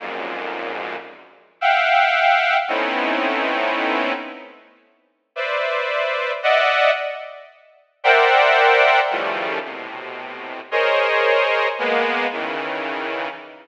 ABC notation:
X:1
M:5/8
L:1/8
Q:1/4=56
K:none
V:1 name="Lead 2 (sawtooth)"
[F,,^F,,^G,,^A,,]2 z [e=f^f=g]2 | [A,B,C^C^DE]3 z2 | [Bcde]2 [d^de^f] z2 | [^Acde^fg]2 [^C,^D,E,=F,G,=A,] [A,,B,,=C,]2 |
[^G^Ac^c^d]2 [^G,^A,B,] [^C,^D,E,]2 |]